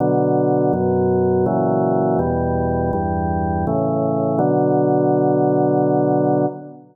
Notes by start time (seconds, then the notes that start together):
0.00 B2 D3 F#3
0.73 F#2 B2 F#3
1.46 A#2 C#3 E3 F#3
2.19 E2 B2 G3
2.93 E2 G2 G3
3.67 A2 C#3 E3
4.39 B2 D3 F#3